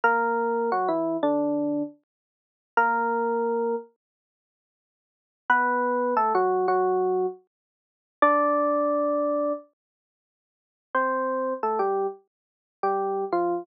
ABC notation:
X:1
M:4/4
L:1/16
Q:1/4=88
K:Bdor
V:1 name="Electric Piano 1"
[^A,^A]4 [F,F] [E,E]2 [D,D]4 z5 | [^A,^A]6 z10 | [B,B]4 [A,A] [F,F]2 [F,F]4 z5 | [Dd]8 z8 |
[K:Ddor] [Cc]4 [A,A] [G,G]2 z4 [G,G]3 [F,F]2 |]